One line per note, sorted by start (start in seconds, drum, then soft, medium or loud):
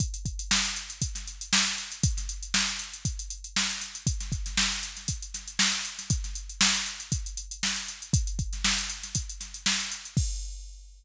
0.00 kick medium
0.00 closed hi-hat loud
0.14 closed hi-hat medium
0.25 kick medium
0.25 closed hi-hat medium
0.39 closed hi-hat medium
0.51 snare loud
0.65 closed hi-hat medium
0.76 closed hi-hat medium
0.90 closed hi-hat medium
1.02 kick medium
1.02 closed hi-hat loud
1.15 snare soft
1.15 closed hi-hat medium
1.27 closed hi-hat medium
1.41 closed hi-hat medium
1.53 snare loud
1.66 closed hi-hat medium
1.78 closed hi-hat medium
1.92 closed hi-hat medium
2.03 kick loud
2.03 closed hi-hat loud
2.17 snare soft
2.17 closed hi-hat medium
2.29 closed hi-hat medium
2.43 closed hi-hat medium
2.54 snare loud
2.68 closed hi-hat medium
2.79 closed hi-hat medium
2.93 closed hi-hat medium
3.05 kick medium
3.05 closed hi-hat medium
3.19 closed hi-hat medium
3.30 closed hi-hat medium
3.44 closed hi-hat medium
3.56 snare loud
3.70 closed hi-hat medium
3.81 snare soft
3.81 closed hi-hat medium
3.95 closed hi-hat medium
4.07 kick loud
4.07 closed hi-hat loud
4.20 snare soft
4.20 closed hi-hat medium
4.32 kick medium
4.32 closed hi-hat medium
4.46 snare soft
4.46 closed hi-hat medium
4.57 snare loud
4.71 closed hi-hat medium
4.83 closed hi-hat medium
4.97 snare soft
4.97 closed hi-hat medium
5.08 kick medium
5.08 closed hi-hat loud
5.22 closed hi-hat medium
5.34 snare soft
5.34 closed hi-hat medium
5.48 closed hi-hat medium
5.59 snare loud
5.73 snare soft
5.73 closed hi-hat medium
5.85 closed hi-hat medium
5.99 snare soft
5.99 closed hi-hat medium
6.10 kick loud
6.10 closed hi-hat loud
6.24 snare soft
6.24 closed hi-hat medium
6.35 closed hi-hat medium
6.49 closed hi-hat medium
6.61 snare loud
6.75 closed hi-hat medium
6.86 closed hi-hat medium
7.00 closed hi-hat medium
7.12 kick medium
7.12 closed hi-hat loud
7.26 closed hi-hat medium
7.37 closed hi-hat medium
7.51 closed hi-hat medium
7.63 snare loud
7.76 closed hi-hat medium
7.88 closed hi-hat medium
8.02 closed hi-hat medium
8.13 kick loud
8.13 closed hi-hat loud
8.27 closed hi-hat medium
8.39 kick medium
8.39 closed hi-hat medium
8.53 snare soft
8.53 closed hi-hat medium
8.64 snare loud
8.78 closed hi-hat medium
8.90 closed hi-hat medium
9.03 snare soft
9.03 closed hi-hat medium
9.15 kick medium
9.15 closed hi-hat loud
9.29 closed hi-hat medium
9.40 snare soft
9.40 closed hi-hat medium
9.54 closed hi-hat medium
9.66 snare loud
9.80 closed hi-hat medium
9.92 closed hi-hat medium
10.05 closed hi-hat medium
10.17 kick loud
10.17 crash loud